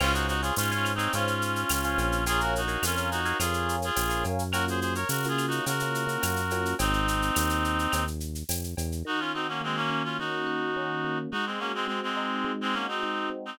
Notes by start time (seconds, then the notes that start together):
0.00 C#2 C#4 F4 C5 C#5 F5 G#5, crash, cowbell, claves
0.13 D#4 F#4, shaker
0.28 D#4 F#4, shaker
0.42 F4 G#4 C5 C#5 F5 G#5, shaker
0.56 G#2 C#4 F4 C5 C#5 F5 G#5, tambourine, shaker
0.71 C#4 F4 C5 C#5 F5 G#5, shaker
0.85 claves, shaker
0.95 C4 D#4 C5 C#5 F5 G#5
0.99 shaker
1.13 G#2 C#4 F4 C5 C#5 F5 G#5, cowbell, shaker
1.27 shaker
1.42 shaker
1.56 shaker
1.69 C#2, tambourine, cowbell, claves, shaker
1.83 C5 C#5 F5 G#5, shaker
1.98 A#1, cowbell, shaker
2.12 shaker
2.26 F4 G#4 A#4 C#5 F5 G#5, cowbell, shaker
2.40 F#4 A#4, shaker
2.56 D#4 F#4, shaker
2.68 A#4 C#5 F5 G#5, shaker
2.82 F2 C#4 F4 A#4 C#5 F5 G#5, tambourine, claves, shaker
2.97 A#4 C#5 F5 G#5, shaker
3.11 D#4 F#4, shaker
3.25 A#4 C#5 F5 G#5, shaker
3.39 F2 F4 G#4 A#4 C#5 F5 G#5, cowbell, claves, shaker
3.54 shaker
3.69 shaker
3.82 F4 G#4, shaker
3.96 A#1, tambourine, cowbell, shaker
4.09 A#4 C#5 F5 G#5, shaker
4.24 F#2, cowbell, shaker
4.39 shaker
4.52 A#3 C#4 F4 F#4 A#4, cowbell, claves, shaker
4.68 G#4 C5, shaker
4.80 G#4 C5, shaker
4.95 A#4 C#5, shaker
5.09 C#3 F#4 A#4, tambourine, shaker
5.23 A#3 C#4 F4 F#4, shaker
5.28 F4 G#4
5.38 claves, shaker
5.47 D#4 F#4, shaker
5.66 C#3 F#4 A#4, cowbell, shaker
5.80 A#3 C#4 F4 F#4, shaker
5.95 shaker
6.07 A#3 C#4 F4 F#4, shaker
6.22 F#2, tambourine, cowbell, claves, shaker
6.36 shaker
6.50 A#3 C#4 F4 F#4, cowbell, shaker
6.65 shaker
6.79 G#1 C4 D#4, cowbell, shaker
6.93 shaker
7.08 shaker
7.22 shaker
7.35 D#2, tambourine, claves, shaker
7.50 shaker
7.64 shaker
7.79 shaker
7.92 D#2, cowbell, claves, shaker
8.07 shaker
8.20 shaker
8.35 shaker
8.49 F2, tambourine, cowbell, shaker
8.64 shaker
8.77 E2, cowbell, shaker
8.92 shaker
9.05 D#3 D#4 F#4
9.19 C#4 F4
9.34 C4 D#4 F#4
9.48 A#3 C#4
9.61 G#3 A#3 C4
9.76 A#3 C#4
9.90 C#4
10.04 C#4 F4
10.19 D#3 D#4 F#4
10.47 F#4
10.76 C#4
11.04 A#3
11.32 G#3 D#4 F#4
11.46 G#3 C4
11.59 A#3 C#4 F#4
11.74 G#3 C4
11.87 G#3 C4
12.03 G#3 C4
12.17 D#4
12.44 G#3
12.61 G#3 C4
12.73 A#3 C#4 F#4
12.88 C4 D#4
13.03 D#4
13.30 C4
13.46 C4 D#4